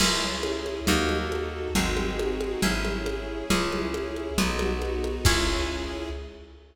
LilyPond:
<<
  \new Staff \with { instrumentName = "Orchestral Harp" } { \time 2/4 \key cis \minor \tempo 4 = 137 <cis' e' gis'>2 | <dis' fis' a'>2 | <bis dis' fis' gis'>2 | <cis' e' gis'>2 |
<cis' e' gis'>2 | <b dis' fis'>2 | <cis' e' gis'>2 | }
  \new Staff \with { instrumentName = "Electric Bass (finger)" } { \clef bass \time 2/4 \key cis \minor cis,2 | dis,2 | gis,,2 | gis,,2 |
cis,2 | b,,2 | cis,2 | }
  \new Staff \with { instrumentName = "String Ensemble 1" } { \time 2/4 \key cis \minor <cis' e' gis'>2 | <dis' fis' a'>2 | <bis dis' fis' gis'>2 | <cis' e' gis'>2 |
<cis' e' gis'>2 | <b dis' fis'>2 | <cis' e' gis'>2 | }
  \new DrumStaff \with { instrumentName = "Drums" } \drummode { \time 2/4 <cgl cymc>4 cgho8 cgho8 | cgl8 cgho8 cgho4 | cgl8 cgho8 cgho8 cgho8 | cgl8 cgho8 cgho4 |
cgl8 cgho8 cgho8 cgho8 | cgl8 cgho8 cgho8 cgho8 | <cymc bd>4 r4 | }
>>